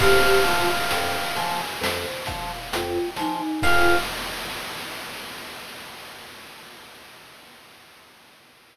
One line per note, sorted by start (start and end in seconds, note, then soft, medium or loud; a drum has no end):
0.00 0.25 F2 loud
0.00 0.42 G4 loud
0.00 0.41 C5 loud
0.00 1.57 F5 medium
0.00 kick loud
0.00 crash loud
0.44 0.69 F3 loud
0.44 0.67 F4 medium
0.44 0.87 F5 medium
0.44 closed hi-hat medium
0.91 1.16 F2 loud
0.91 1.32 G5 medium
0.91 closed hi-hat loud
1.36 1.61 F3 loud
1.36 1.77 G#5 medium
1.36 snare soft
1.36 closed hi-hat medium
1.81 2.06 F2 loud
1.81 2.23 C5 loud
1.81 snare loud
2.26 2.52 F3 medium
2.26 2.68 F5 loud
2.26 kick medium
2.26 closed hi-hat medium
2.72 2.99 F2 loud
2.72 3.10 F4 medium
2.72 3.13 G5 medium
2.72 closed hi-hat loud
3.16 3.42 F3 loud
3.16 3.62 D#4 medium
3.16 3.60 G#5 medium
3.16 snare medium
3.16 closed hi-hat medium
3.62 3.96 F2 loud
3.62 3.97 F4 loud
3.62 3.95 C5 loud
3.62 3.95 F5 loud
3.62 3.95 G5 loud
3.62 3.95 G#5 loud
3.62 kick loud
3.62 crash loud